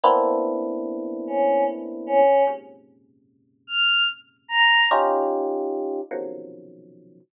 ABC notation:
X:1
M:6/8
L:1/8
Q:3/8=49
K:none
V:1 name="Electric Piano 1"
[^A,B,CDE]6 | [^F,,^G,,^A,,C,^C,]6 | [^C^DFG]3 [B,,=C,^C,^D,F,^F,]3 |]
V:2 name="Choir Aahs"
z3 ^C z C | z3 f' z ^a | z6 |]